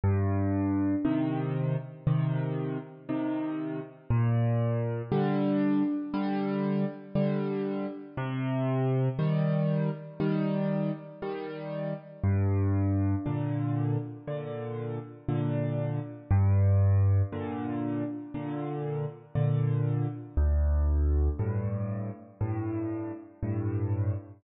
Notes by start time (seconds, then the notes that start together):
0.04 G2
1.05 C3 D#3
2.07 C3 D#3
3.09 C3 D#3
4.10 A#2
5.12 D3 G3
6.14 D3 G3
7.15 D3 G3
8.17 C3
9.19 D#3 G3
10.20 D#3 G3
11.22 D#3 G3
12.24 G2
13.26 A#2 D3
14.28 A#2 D3
15.29 A#2 D3
16.31 G2
17.32 A#2 D3
18.34 A#2 D3
19.35 A#2 D3
20.37 D2
21.39 G2 A2
22.41 G2 A2
23.43 G2 A2